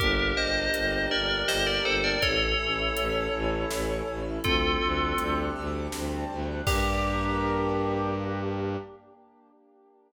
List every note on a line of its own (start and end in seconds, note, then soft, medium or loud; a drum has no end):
0.00 0.32 G1 loud
0.00 2.19 A#3 loud
0.00 1.11 D4 medium
0.00 2.19 D4 medium
0.00 0.33 G4 medium
0.00 2.19 G4 loud
0.00 0.33 A#4 loud
0.00 kick medium
0.00 closed hi-hat medium
0.37 0.69 G1 medium
0.37 1.48 G4 medium
0.37 1.08 C5 medium
0.37 1.08 D#5 medium
0.74 1.06 G1 medium
0.74 1.85 A#4 medium
0.74 closed hi-hat medium
1.11 1.43 G1 medium
1.11 2.17 D4 medium
1.11 1.41 A#4 medium
1.11 1.41 D5 medium
1.48 1.79 G1 medium
1.48 2.18 G4 medium
1.48 1.66 C5 medium
1.48 1.66 D#5 medium
1.48 snare loud
1.67 1.84 A#4 medium
1.67 1.84 D5 medium
1.85 2.16 G1 medium
1.85 2.03 A4 medium
1.85 2.21 A#4 medium
1.85 2.03 C5 loud
2.04 2.21 A#4 medium
2.04 2.21 D5 medium
2.22 2.54 A1 medium
2.22 4.43 A3 loud
2.22 3.33 C#4 medium
2.22 4.43 C#4 medium
2.22 4.43 E4 loud
2.22 4.19 A4 loud
2.22 4.19 C#5 loud
2.22 kick medium
2.22 closed hi-hat medium
2.59 2.90 A1 medium
2.59 3.70 E4 medium
2.96 3.28 A1 medium
2.96 4.07 A4 medium
2.96 closed hi-hat medium
3.33 3.65 A1 medium
3.33 4.39 C#4 medium
3.70 4.02 A1 medium
3.70 4.41 E4 medium
3.70 snare loud
4.07 4.39 A1 medium
4.07 4.43 A4 medium
4.44 4.76 D2 medium
4.44 6.64 G3 loud
4.44 6.64 A3 medium
4.44 6.64 C4 medium
4.44 5.92 C4 loud
4.44 6.64 D4 medium
4.44 5.38 F4 loud
4.44 5.38 A4 loud
4.44 kick loud
4.44 closed hi-hat medium
4.81 5.13 D2 medium
4.81 6.29 D4 medium
5.18 5.50 D2 medium
5.18 6.59 G4 medium
5.18 closed hi-hat medium
5.56 5.88 D2 medium
5.56 6.61 A4 medium
5.92 6.24 D2 medium
5.92 6.63 C4 medium
5.92 snare medium
6.29 6.61 D2 medium
6.29 6.65 D4 medium
6.67 8.76 G2 loud
6.67 8.77 A#3 medium
6.67 8.76 D4 loud
6.67 8.77 D4 loud
6.67 8.76 G4 loud
6.67 8.77 G4 loud
6.67 8.76 A#4 loud
6.67 kick loud
6.67 crash loud